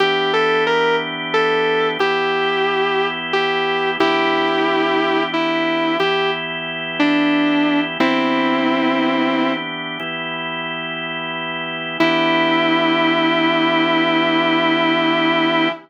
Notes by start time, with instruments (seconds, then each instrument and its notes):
0.00 drawbar organ E3 B3 D4 G4, distortion guitar G4
0.33 distortion guitar A4
0.67 distortion guitar A#4
1.34 distortion guitar A4
1.99 drawbar organ E3 B3 E4 G4, distortion guitar G4
3.33 distortion guitar G4
4.00 drawbar organ E3 B3 D4 G4, distortion guitar E4 G4
5.33 distortion guitar E4
6.00 drawbar organ E3 B3 E4 G4, distortion guitar G4
7.00 distortion guitar D4
8.00 drawbar organ E3 B3 D4 G4, distortion guitar C4 E4
10.00 drawbar organ E3 B3 E4 G4
12.00 drawbar organ E3 B3 D4 G4, distortion guitar E4